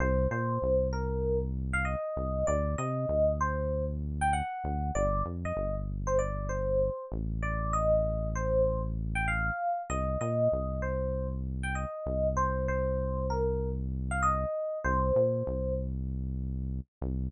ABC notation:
X:1
M:4/4
L:1/16
Q:"Swing 16ths" 1/4=97
K:Cm
V:1 name="Electric Piano 1"
c2 c4 B3 z2 f e4 | d2 e4 c3 z2 g ^f4 | d2 z e2 z2 c d2 c4 z2 | d2 e4 c3 z2 g f4 |
e2 e4 c3 z2 g e4 | c2 c4 B3 z2 f e4 | c6 z10 |]
V:2 name="Synth Bass 1" clef=bass
C,,2 B,,2 C,,10 C,,2 | D,,2 C,2 D,,10 D,,2 | G,,,2 F,,2 G,,,10 =A,,,2- | =A,,,16 |
C,,2 B,,2 C,,10 C,,2- | C,,16 | C,,2 B,,2 C,,10 C,,2 |]